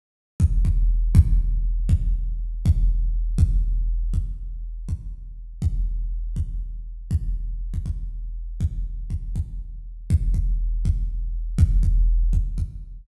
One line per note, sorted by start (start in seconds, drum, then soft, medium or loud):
0.40 kick loud
0.65 kick loud
1.15 kick loud
1.89 kick loud
2.66 kick loud
3.38 kick loud
4.14 kick medium
4.89 kick medium
5.62 kick loud
6.36 kick medium
7.11 kick loud
7.74 kick medium
7.86 kick medium
8.60 kick medium
9.10 kick medium
9.36 kick medium
10.10 kick loud
10.34 kick medium
10.85 kick loud
11.58 kick loud
11.83 kick medium
12.33 kick medium
12.58 kick medium